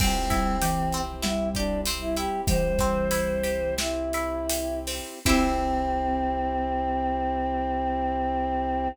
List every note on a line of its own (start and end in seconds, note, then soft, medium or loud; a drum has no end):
0.00 2.27 C2 medium
0.00 0.27 G3 medium
0.00 1.01 C4 medium
0.00 5.19 C4 medium
0.00 0.29 C4 medium
0.00 5.19 E4 medium
0.00 5.19 G4 medium
0.00 kick loud
0.00 crash loud
0.30 0.56 G3 medium
0.30 0.58 E4 medium
0.30 kick loud
0.30 snare medium
0.30 closed hi-hat medium
0.61 1.13 E3 medium
0.61 0.90 G4 medium
0.61 closed hi-hat loud
0.92 1.22 C4 medium
0.92 closed hi-hat medium
1.22 2.40 G3 medium
1.22 1.50 E4 medium
1.22 1.49 E4 medium
1.22 snare loud
1.55 1.81 D4 medium
1.55 1.84 G4 medium
1.55 kick medium
1.55 closed hi-hat medium
1.85 2.15 C4 medium
1.85 closed hi-hat loud
2.01 2.16 E4 medium
2.16 2.45 E4 medium
2.16 2.41 G4 medium
2.16 closed hi-hat medium
2.47 5.01 C2 medium
2.47 3.72 E3 medium
2.47 3.72 G3 medium
2.47 2.76 G4 medium
2.47 3.75 C5 loud
2.47 kick loud
2.47 closed hi-hat loud
2.79 3.09 C4 medium
2.79 kick loud
2.79 snare medium
2.79 closed hi-hat medium
3.11 3.41 E4 medium
3.11 closed hi-hat loud
3.43 3.74 G4 medium
3.43 closed hi-hat medium
3.78 4.09 C4 medium
3.78 4.79 E4 medium
3.78 snare loud
4.13 4.47 E4 medium
4.13 closed hi-hat medium
4.49 4.83 G4 medium
4.49 closed hi-hat loud
4.87 5.22 C4 medium
4.87 open hi-hat medium
5.25 8.88 C2 loud
5.25 8.88 C4 loud
5.25 8.88 C4 medium
5.25 8.89 C4 medium
5.25 8.88 E4 loud
5.25 8.89 E4 loud
5.25 8.88 G4 loud
5.25 8.89 G4 loud
5.25 kick loud
5.25 crash loud